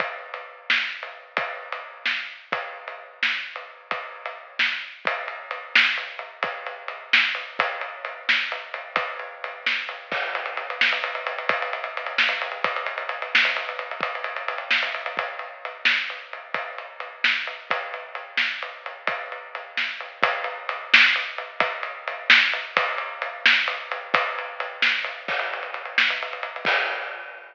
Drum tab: CC |------------|----------|------------|----------|
RD |x--x-----x--|x--x------|x--x-----x--|x--x------|
SD |------o-----|------o---|------o-----|------o---|
BD |o-----------|o---------|o-----------|o---------|

CC |------------|----------|------------|----------|
RD |x-x-x---x-x-|x-x-x---x-|x-x-x---x-x-|x-x-x---x-|
SD |------o-----|------o---|------o-----|------o---|
BD |o-----------|o---------|o-----------|o---------|

CC |x-----------|----------|------------|----------|
RD |-xxxxx-xxxxx|xxxxxx-xxx|xxxxxx-xxxxx|xxxxxx-xxx|
SD |------o-----|------o---|------o-----|------o---|
BD |o-----------|o---------|o-----------|o---------|

CC |------------|----------|------------|----------|
RD |x-x-x---x-x-|x-x-x---x-|x-x-x---x-x-|x-x-x---x-|
SD |------o-----|------o---|------o-----|------o---|
BD |o-----------|o---------|o-----------|o---------|

CC |------------|----------|------------|----------|
RD |x-x-x---x-x-|x-x-x---x-|x-x-x---x-x-|x-x-x---x-|
SD |------o-----|------o---|------o-----|------o---|
BD |o-----------|o---------|o-----------|o---------|

CC |x-----------|x---------|
RD |-xxxxx-xxxxx|----------|
SD |------o-----|----------|
BD |o-----------|o---------|